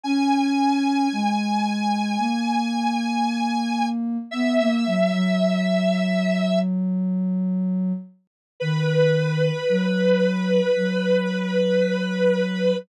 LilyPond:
<<
  \new Staff \with { instrumentName = "Lead 1 (square)" } { \time 4/4 \key b \major \tempo 4 = 56 gis''1 | e''2~ e''8 r4. | b'1 | }
  \new Staff \with { instrumentName = "Ocarina" } { \time 4/4 \key b \major cis'4 gis4 ais2 | b16 ais16 fis16 fis2~ fis8. r8 | dis4 fis4 fis2 | }
>>